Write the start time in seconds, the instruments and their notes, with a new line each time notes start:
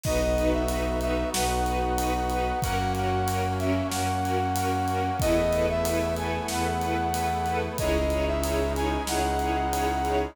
0.03 violin B1, brass section B3 D#4 F#4 D#5, string ensemble 1 D#4 F#4 B4, kick, crash
0.37 string ensemble 1 D#4 F#4 B4, ride
0.53 brass section E5
0.68 string ensemble 1 D#4 F#4 B4, ride
1.01 string ensemble 1 D#4 F#4 B4, brass section E5, ride
1.33 violin B1, string ensemble 1 D#4 F#4 B4, brass section F#5, snare
1.65 string ensemble 1 D#4 F#4 B4, ride
1.98 string ensemble 1 D#4 F#4 B4, ride
2.30 string ensemble 1 D#4 F#4 B4, ride
2.62 violin F#2, brass section A#3 C#4 F#4 F#5, string ensemble 1 C#4 F#4 A#4, kick, ride
2.95 string ensemble 1 C#4 F#4 A#4, brass section F#5, ride
3.27 string ensemble 1 C#4 F#4 A#4, ride
3.59 string ensemble 1 C#4 F#4 A#4, brass section E5, ride
3.92 violin F#2, string ensemble 1 C#4 F#4 A#4, brass section F#5, snare
4.24 string ensemble 1 C#4 F#4 A#4, ride
4.56 string ensemble 1 C#4 F#4 A#4, ride
4.88 string ensemble 1 C#4 F#4 A#4, ride
5.20 violin E2, brass section A3 B3 E4 D#5, string ensemble 1 E4 A4 B4, kick, ride
5.53 string ensemble 1 E4 A4 B4, ride
5.69 brass section E5
5.85 string ensemble 1 E4 A4 B4, ride
6.17 string ensemble 1 E4 A4 B4, brass section G#5, ride
6.48 violin E2, string ensemble 1 E4 A4 B4, brass section F#5, snare
6.81 string ensemble 1 E4 A4 B4, ride
7.14 string ensemble 1 E4 A4 B4, ride
7.46 string ensemble 1 E4 A4 B4, ride
7.78 violin C#2, brass section G#3 C#4 D#4 E4 D#5, string ensemble 1 D#4 E4 G#4 C#5, kick, ride
8.10 string ensemble 1 D#4 E4 G#4 C#5, ride
8.27 brass section E5
8.43 string ensemble 1 D#4 E4 G#4 C#5, ride
8.75 string ensemble 1 D#4 E4 G#4 C#5, brass section G#5, ride
9.07 violin C#2, string ensemble 1 D#4 E4 G#4 C#5, brass section F#5, snare
9.39 string ensemble 1 D#4 E4 G#4 C#5, ride
9.73 string ensemble 1 D#4 E4 G#4 C#5, ride
10.05 string ensemble 1 D#4 E4 G#4 C#5, ride